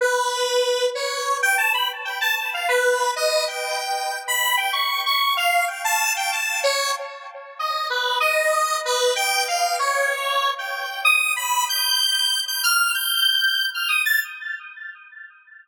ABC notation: X:1
M:5/8
L:1/16
Q:1/4=95
K:none
V:1 name="Lead 1 (square)"
B6 ^c3 g | a b z g a a f B3 | ^d2 g5 b2 g | ^c'2 c'2 f2 g a2 g |
a2 ^c2 z4 ^d2 | B2 ^d4 B2 g2 | f2 ^c5 g3 | ^d'2 b2 g'5 g' |
f'2 g'5 f' ^d' a' |]